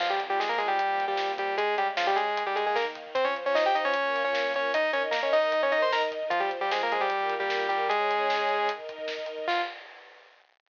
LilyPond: <<
  \new Staff \with { instrumentName = "Lead 2 (sawtooth)" } { \time 4/4 \key f \minor \tempo 4 = 152 <f f'>16 <g g'>16 r16 <g g'>16 <aes aes'>16 <bes bes'>16 <aes aes'>16 <g g'>4 <g g'>8. <g g'>8 | <aes aes'>8 <g g'>16 r16 <f f'>16 <g g'>16 <aes aes'>8. <g g'>16 <aes aes'>16 <aes aes'>16 <bes bes'>16 r8. | <c' c''>16 <des' des''>16 r16 <des' des''>16 <ees' ees''>16 <g' g''>16 <ees' ees''>16 <des' des''>4 <des' des''>8. <des' des''>8 | <ees' ees''>8 <des' des''>16 r16 <bes bes'>16 <des' des''>16 <ees' ees''>8. <des' des''>16 <ees' ees''>16 <c'' c'''>16 <bes' bes''>16 r8. |
<f f'>16 <g g'>16 r16 <g g'>16 <aes aes'>16 <bes bes'>16 <aes aes'>16 <g g'>4 <g g'>8. <g g'>8 | <aes aes'>2~ <aes aes'>8 r4. | f'4 r2. | }
  \new Staff \with { instrumentName = "String Ensemble 1" } { \time 4/4 \key f \minor <f c' f'>2 <bes, f bes>2 | <des aes des'>2 <ees bes ees'>2 | <f f' c''>2 <bes f' bes'>2 | <ees' bes' ees''>2 <ees' bes' ees''>2 |
<f f' c''>2 <bes f' bes'>2 | <des' aes' des''>2 <ees' bes' ees''>2 | <f c' f'>4 r2. | }
  \new DrumStaff \with { instrumentName = "Drums" } \drummode { \time 4/4 <cymc bd>16 bd16 <hh bd>16 bd16 <bd sn>16 bd16 <hh bd>16 bd16 <hh bd>16 bd16 <hh bd>16 bd16 <bd sn>16 bd16 <hh bd>16 bd16 | <hh bd>16 bd16 <hh bd>16 bd16 <bd sn>16 bd16 <hh bd>16 bd16 <hh bd>16 bd16 <hh bd>16 bd16 <bd sn>16 bd16 <hh bd>16 bd16 | <hh bd>16 bd16 <hh bd>16 bd16 <bd sn>16 bd16 <hh bd>16 bd16 <hh bd>16 bd16 <hh bd>16 bd16 <bd sn>16 bd16 <hh bd>16 bd16 | <hh bd>16 bd16 <hh bd>16 bd16 <bd sn>16 bd16 <hh bd>16 bd16 <hh bd>16 bd16 <hh bd>16 bd16 <bd sn>16 bd16 <hh bd>16 bd16 |
<hh bd>16 bd16 <hh bd>16 bd16 <bd sn>16 bd16 <hh bd>16 bd16 <hh bd>16 bd16 <hh bd>16 bd16 <bd sn>16 bd16 <hh bd>16 bd16 | <hh bd>16 bd16 <hh bd>16 bd16 <bd sn>16 bd16 <hh bd>16 bd16 <hh bd>16 bd16 <hh bd>16 bd16 <bd sn>16 bd16 hh16 bd16 | <cymc bd>4 r4 r4 r4 | }
>>